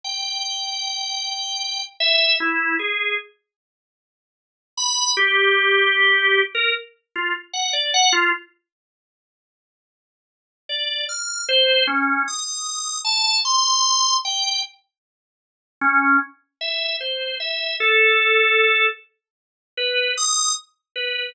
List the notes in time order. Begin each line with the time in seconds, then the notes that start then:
0.04 G5
2.00 E5
2.40 E4
2.79 G#4
4.77 B5
5.17 G4
6.55 A#4
7.15 F4
7.53 F#5
7.73 D5
7.94 F#5
8.13 F4
10.69 D5
11.09 F6
11.49 C5
11.87 C#4
12.28 D#6
13.04 A5
13.45 C6
14.25 G5
15.81 C#4
16.61 E5
17.00 C5
17.40 E5
17.80 A4
19.77 B4
20.17 D#6
20.96 B4